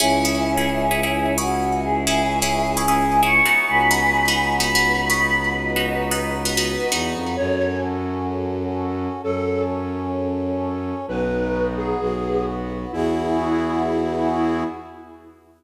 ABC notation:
X:1
M:4/4
L:1/16
Q:1/4=130
K:C#m
V:1 name="Choir Aahs"
[CE]12 F4 | [EG]8 g4 c'4 | [gb]8 b4 b4 | [Bd]8 B4 z4 |
[K:E] z16 | z16 | z16 | z16 |]
V:2 name="Flute"
z16 | z16 | z16 | z16 |
[K:E] c4 z12 | A4 z12 | B6 G6 z4 | E16 |]
V:3 name="Pizzicato Strings"
[CEG]2 [CEG]3 [CEG]3 [CEG] [CEG]3 [CEG]4- | [CEG]2 [CEG]3 [CEG]3 [CEG] [CEG]3 [CEG]2 [B,DF]2- | [B,DF]2 [B,DF]3 [B,DF]3 [B,DF] [B,DF]3 [B,DF]4- | [B,DF]2 [B,DF]3 [B,DF]3 [B,DF] [B,DF]3 [B,DF]4 |
[K:E] z16 | z16 | z16 | z16 |]
V:4 name="Violin" clef=bass
C,,16- | C,,16 | C,,16- | C,,12 E,,2 =F,,2 |
[K:E] F,,16 | F,,16 | B,,,8 B,,,8 | E,,16 |]
V:5 name="Brass Section"
[CEG]16- | [CEG]16 | [B,DF]16- | [B,DF]16 |
[K:E] [CFA]16 | [CAc]16 | [B,DF]8 [B,FB]8 | [B,EFG]16 |]